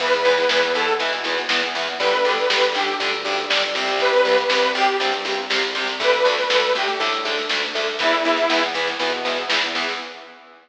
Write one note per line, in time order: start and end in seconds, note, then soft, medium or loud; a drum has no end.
0.00 0.45 E2 medium
0.00 0.10 E3 medium
0.00 0.10 B3 medium
0.00 0.35 B4 medium
0.00 kick loud
0.00 snare medium
0.00 crash loud
0.13 snare medium
0.25 0.35 E3 medium
0.25 0.35 B3 medium
0.25 snare medium
0.38 0.50 B4 medium
0.38 snare medium
0.49 0.96 E2 medium
0.49 0.60 E3 medium
0.49 0.60 B3 medium
0.49 0.72 B4 medium
0.49 snare loud
0.62 snare medium
0.75 0.85 E3 medium
0.75 0.85 B3 medium
0.75 0.96 A4 medium
0.75 snare medium
0.88 snare medium
0.99 1.46 B2 medium
0.99 1.10 E3 medium
0.99 1.10 B3 medium
0.99 kick medium
0.99 snare medium
1.13 snare medium
1.24 1.35 E3 medium
1.24 1.35 B3 medium
1.24 snare medium
1.38 snare medium
1.49 1.95 E2 medium
1.49 1.60 E3 medium
1.49 1.60 B3 medium
1.49 snare loud
1.63 snare medium
1.75 1.85 E3 medium
1.75 1.85 B3 medium
1.75 snare medium
1.87 snare medium
1.99 2.44 G1 medium
1.99 2.10 D3 medium
1.99 2.10 G3 medium
1.99 2.32 B4 medium
1.99 kick loud
1.99 snare medium
2.13 snare medium
2.24 2.35 D3 medium
2.24 2.35 G3 medium
2.24 snare medium
2.38 2.48 B4 medium
2.38 snare medium
2.49 2.94 G1 medium
2.49 2.60 D3 medium
2.49 2.60 G3 medium
2.49 2.73 B4 medium
2.49 snare loud
2.62 snare medium
2.74 2.85 D3 medium
2.74 2.85 G3 medium
2.74 2.95 G4 medium
2.74 snare medium
2.88 snare medium
3.00 3.46 D2 medium
3.00 3.10 D3 medium
3.00 3.10 G3 medium
3.00 kick loud
3.00 snare medium
3.12 snare medium
3.25 3.35 D3 medium
3.25 3.35 G3 medium
3.25 snare medium
3.37 snare medium
3.50 3.95 G1 medium
3.50 3.60 D3 medium
3.50 3.60 G3 medium
3.50 snare loud
3.62 snare medium
3.75 4.10 C3 medium
3.75 4.10 G3 medium
3.75 snare medium
3.88 snare medium
3.99 4.44 C2 medium
3.99 4.37 B4 medium
3.99 kick loud
3.99 snare medium
4.13 snare medium
4.25 4.35 C3 medium
4.25 4.35 G3 medium
4.25 snare medium
4.38 4.49 B4 medium
4.38 snare medium
4.50 4.96 C2 medium
4.50 4.60 C3 medium
4.50 4.60 G3 medium
4.50 4.72 B4 medium
4.50 snare loud
4.62 snare medium
4.75 4.85 C3 medium
4.75 4.85 G3 medium
4.75 4.96 G4 medium
4.75 snare medium
4.88 snare medium
5.00 5.46 G2 medium
5.00 5.10 C3 medium
5.00 5.10 G3 medium
5.00 kick medium
5.00 snare medium
5.12 snare medium
5.25 5.35 C3 medium
5.25 5.35 G3 medium
5.25 snare medium
5.37 snare medium
5.50 5.96 C2 medium
5.50 5.60 C3 medium
5.50 5.60 G3 medium
5.50 snare loud
5.62 snare medium
5.75 5.85 C3 medium
5.75 5.85 G3 medium
5.75 snare medium
5.87 snare medium
5.99 6.44 D2 medium
5.99 6.10 D3 loud
5.99 6.10 A3 medium
5.99 6.31 B4 medium
5.99 kick loud
5.99 snare medium
6.12 snare medium
6.25 6.35 D3 medium
6.25 6.35 A3 medium
6.25 snare medium
6.37 6.50 B4 medium
6.37 snare medium
6.49 6.94 D2 medium
6.49 6.60 D3 medium
6.49 6.60 A3 medium
6.49 6.73 B4 medium
6.49 snare loud
6.63 snare medium
6.75 6.85 D3 medium
6.75 6.85 A3 medium
6.75 6.98 G4 medium
6.75 snare medium
6.88 snare medium
7.00 7.45 A2 medium
7.00 7.10 D3 medium
7.00 7.10 A3 medium
7.00 kick medium
7.00 snare medium
7.12 snare medium
7.25 7.35 D3 medium
7.25 7.35 A3 medium
7.25 snare medium
7.38 snare medium
7.49 7.96 D2 medium
7.49 7.60 D3 medium
7.49 7.60 A3 medium
7.49 snare loud
7.62 snare medium
7.75 7.85 D3 medium
7.75 7.85 A3 medium
7.75 snare medium
7.87 snare medium
7.99 8.46 E2 medium
7.99 8.10 E3 medium
7.99 8.10 B3 medium
7.99 8.63 E4 medium
7.99 kick loud
7.99 snare medium
8.13 snare medium
8.25 8.35 E3 medium
8.25 8.35 B3 medium
8.25 snare medium
8.36 snare medium
8.49 8.94 E2 medium
8.49 8.60 E3 medium
8.49 8.60 B3 medium
8.49 snare loud
8.63 snare medium
8.74 8.85 E3 medium
8.74 8.85 B3 medium
8.74 snare medium
8.87 snare medium
8.99 9.45 B2 medium
8.99 9.10 E3 medium
8.99 9.10 B3 medium
8.99 kick medium
8.99 snare medium
9.12 snare medium
9.25 9.35 E3 medium
9.25 9.35 B3 medium
9.25 snare medium
9.37 snare medium
9.48 9.93 E2 medium
9.48 9.60 E3 medium
9.48 9.60 B3 medium
9.48 snare loud
9.62 snare medium
9.75 9.85 E3 medium
9.75 9.85 B3 medium
9.75 snare medium
9.89 snare medium